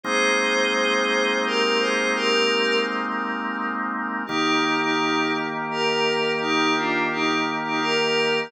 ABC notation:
X:1
M:3/4
L:1/16
Q:1/4=85
K:Eb
V:1 name="Pad 5 (bowed)"
[Ac]8 [GB]2 [Ac]2 | [GB]4 z8 | [EG]3 [EG]3 z2 [GB]4 | [EG]2 [DF]2 [EG]2 z [EG] [GB]4 |]
V:2 name="Drawbar Organ"
[A,B,CE]12- | [A,B,CE]12 | [E,B,G]12- | [E,B,G]12 |]